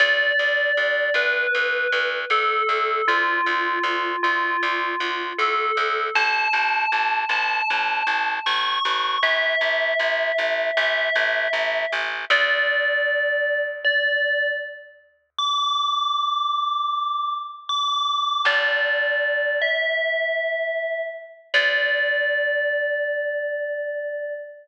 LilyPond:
<<
  \new Staff \with { instrumentName = "Tubular Bells" } { \time 4/4 \key d \dorian \tempo 4 = 78 d''4. b'4. a'4 | f'4. f'4. a'4 | a''4. a''4. cis'''4 | e''2 e''4. r8 |
d''2 d''4 r4 | d'''2. d'''4 | d''4. e''2 r8 | d''1 | }
  \new Staff \with { instrumentName = "Electric Bass (finger)" } { \clef bass \time 4/4 \key d \dorian d,8 d,8 d,8 d,8 d,8 d,8 d,8 d,8 | d,8 d,8 d,8 d,8 d,8 d,8 d,8 d,8 | a,,8 a,,8 a,,8 a,,8 a,,8 a,,8 a,,8 a,,8 | a,,8 a,,8 a,,8 a,,8 a,,8 a,,8 a,,8 a,,8 |
d,1~ | d,1 | g,,1 | d,1 | }
>>